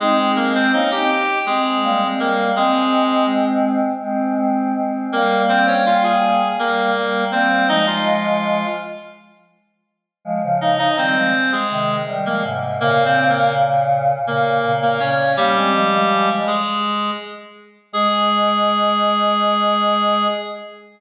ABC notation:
X:1
M:7/8
L:1/16
Q:1/4=82
K:Ab
V:1 name="Clarinet"
[A,A]2 [B,B] [Cc] [Ee] [Gg]3 [A,A]4 [B,B]2 | [A,A]4 z10 | [B,B]2 [Cc] [Dd] [Ff] [Aa]3 [B,B]4 [Cc]2 | [Ee] [Ff]5 z8 |
z2 [Ee] [Ee] [Cc]3 [A,A]3 z [B,B] z2 | (3[B,B]2 [Cc]2 [B,B]2 z4 [B,B]3 [B,B] [Dd]2 | [G,G]6 [A,A]4 z4 | A14 |]
V:2 name="Choir Aahs"
[CE] [A,C]3 [B,D] [CE] z2 [A,C]2 [G,B,] [A,C] [G,B,]2 | [A,C]8 [A,C]2 [A,C]2 [A,C]2 | [G,B,]8 [G,B,]2 [G,B,]2 [G,B,]2 | [F,A,]6 z8 |
[F,A,] [D,F,]3 [E,G,] [F,A,] z2 [C,E,]2 [E,G,] [F,A,] [A,,C,]2 | [B,,D,]8 [B,,D,]2 [B,,D,]2 [B,,D,]2 | [B,D] [A,C] [F,A,] [F,A,]3 z8 | A,14 |]